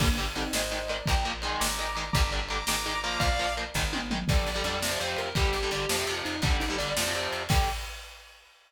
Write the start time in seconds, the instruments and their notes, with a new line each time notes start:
0.00 electric bass (finger) G1, overdriven guitar D3 G3, lead 2 (sawtooth) A#3 D4, kick, crash
0.17 overdriven guitar D3 G3, ride
0.35 overdriven guitar D3 G3, lead 2 (sawtooth) C4 D#4, ride
0.53 electric bass (finger) G#1, overdriven guitar D#3 G#3, lead 2 (sawtooth) C5 D#5, snare
0.71 overdriven guitar D#3 G#3, ride
0.88 overdriven guitar D#3 G#3, lead 2 (sawtooth) A#4 D5, ride
1.06 electric bass (finger) A#1, overdriven guitar F3 A#3, lead 2 (sawtooth) G5 A#5, kick, ride
1.24 overdriven guitar F3 A#3, ride
1.42 overdriven guitar D#3 G#3, lead 2 (sawtooth) G#5 C6, ride
1.60 electric bass (finger) G#1, lead 2 (sawtooth) A#5 D6, snare
1.79 overdriven guitar D#3 G#3, ride
1.95 overdriven guitar D#3 G#3, lead 2 (sawtooth) A#5 D6, ride
2.13 electric bass (finger) G1, overdriven guitar D3 G3, lead 2 (sawtooth) A#5 D6, kick, ride
2.32 overdriven guitar D3 G3, ride
2.49 overdriven guitar D3 G3, lead 2 (sawtooth) A#5 D6, ride
2.67 electric bass (finger) G#1, overdriven guitar D#3 G#3, lead 2 (sawtooth) A#5 D6, snare
2.86 overdriven guitar D#3 G#3, ride
3.04 overdriven guitar F3 A#3, lead 2 (sawtooth) A#5 D6, ride
3.19 electric bass (finger) A#1, lead 2 (sawtooth) D5 F5, kick, ride
3.39 overdriven guitar F3 A#3, ride
3.57 overdriven guitar F3 A#3, ride
3.74 electric bass (finger) G#1, overdriven guitar D#3 G#3, kick, snare
3.93 overdriven guitar D#3 G#3, high tom
4.11 overdriven guitar D#3 G#3, mid tom
4.28 electric bass (finger) G1, overdriven guitar D3 G3, distortion guitar D5, kick, crash
4.38 ride
4.47 electric bass (finger) G1, ride
4.55 overdriven guitar D3 G3, ride
4.64 electric bass (finger) F2, overdriven guitar D3 G3, ride
4.73 ride
4.82 overdriven guitar C3 F3, snare
4.91 overdriven guitar C3 F3, ride
4.99 electric bass (finger) F2, overdriven guitar C3 F3, ride
5.08 ride
5.17 electric bass (finger) F2, distortion guitar A#4, ride
5.26 ride
5.35 electric bass (finger) G1, overdriven guitar D3 G3, distortion guitar G4, kick, ride
5.45 ride
5.53 electric bass (finger) G1, ride
5.63 overdriven guitar D3 G3, ride
5.71 electric bass (finger) G1, overdriven guitar D3 G3, ride
5.80 ride
5.89 electric bass (finger) F2, overdriven guitar C3 F3, snare
5.98 overdriven guitar C3 F3, ride
6.07 electric bass (finger) F2, overdriven guitar C3 F3, ride
6.18 ride
6.25 electric bass (finger) F2, distortion guitar D#4, ride
6.33 ride
6.42 electric bass (finger) G1, overdriven guitar D3 G3, distortion guitar D4, kick, ride
6.51 ride
6.60 electric bass (finger) G1, distortion guitar D#4, ride
6.69 overdriven guitar D3 G3, ride
6.78 electric bass (finger) G1, overdriven guitar D3 G3, distortion guitar D5, ride
6.88 ride
6.97 electric bass (finger) F2, overdriven guitar C3 F3, snare
7.05 overdriven guitar C3 F3, ride
7.13 electric bass (finger) F2, overdriven guitar C3 F3, ride
7.22 ride
7.33 electric bass (finger) F2, ride
7.41 ride
7.49 electric bass (finger) G2, overdriven guitar D3 G3, distortion guitar G5, kick, crash